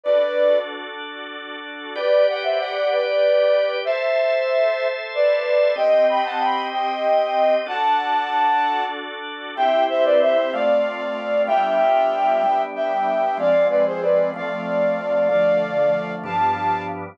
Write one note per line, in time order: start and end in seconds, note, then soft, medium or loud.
0.03 1.94 D4 medium
0.03 1.94 F#4 medium
0.03 1.94 A4 medium
0.03 0.57 B4 medium
0.03 0.57 D5 medium
1.95 3.84 G4 loud
1.95 2.25 B4 medium
1.95 3.84 B4 medium
1.95 2.25 D5 medium
1.95 3.84 D5 medium
2.28 2.44 D5 medium
2.28 2.44 F#5 medium
2.43 2.58 C5 medium
2.43 2.58 E5 medium
2.58 2.88 D5 medium
2.58 2.88 F#5 medium
2.90 3.76 B4 medium
2.90 3.76 D5 medium
3.84 5.76 A4 medium
3.84 4.86 C5 medium
3.84 5.76 C5 medium
3.84 4.86 E5 medium
3.84 5.76 E5 medium
5.14 5.72 B4 medium
5.14 5.72 D5 medium
5.76 7.64 C4 medium
5.76 7.64 G4 medium
5.76 7.64 D#5 medium
5.76 6.05 D#5 medium
5.76 6.05 G5 medium
6.09 6.24 G5 medium
6.09 6.24 B5 medium
6.24 6.39 F#5 medium
6.24 6.39 A5 medium
6.39 6.67 G5 medium
6.39 6.67 B5 medium
6.71 7.54 D#5 medium
6.71 7.54 G5 medium
7.66 9.55 D4 medium
7.66 9.55 F#4 medium
7.66 9.55 A4 medium
7.66 8.83 F#5 medium
7.66 8.83 A5 medium
9.56 10.52 C4 medium
9.56 10.52 E4 medium
9.56 10.52 G4 medium
9.56 9.84 E5 medium
9.56 9.84 G5 medium
9.89 10.04 C5 medium
9.89 10.04 E5 medium
10.04 10.19 B4 medium
10.04 10.19 D5 medium
10.21 10.51 C5 medium
10.21 10.51 E5 medium
10.53 11.48 A3 medium
10.53 11.48 C4 loud
10.53 11.47 F4 medium
10.53 11.41 D5 medium
10.53 11.41 F5 medium
11.47 12.42 G3 loud
11.47 12.42 B3 medium
11.47 12.42 D4 loud
11.47 12.42 F4 medium
11.47 12.61 E5 medium
11.47 12.61 G5 medium
12.44 13.38 G3 medium
12.44 13.38 B3 medium
12.44 13.38 D4 medium
12.75 13.37 E5 medium
12.75 13.37 G5 medium
13.37 14.31 F3 medium
13.37 14.31 G#3 medium
13.37 14.31 C4 loud
13.37 13.66 D5 medium
13.37 13.66 F5 medium
13.69 13.84 B4 medium
13.69 13.84 D5 medium
13.86 14.01 G#4 medium
13.86 14.01 C5 medium
14.01 14.29 B4 medium
14.01 14.29 D5 medium
14.34 15.28 F3 medium
14.34 15.28 A3 loud
14.34 15.28 C4 medium
14.34 15.28 D5 medium
14.34 15.28 F5 medium
15.29 16.24 D3 medium
15.29 16.23 F3 loud
15.29 16.24 A3 medium
15.29 16.12 D5 medium
15.29 16.12 F5 medium
16.23 17.18 G2 medium
16.23 17.18 F3 medium
16.23 17.18 B3 medium
16.23 17.18 D4 medium
16.23 16.83 F5 medium
16.23 16.83 A5 medium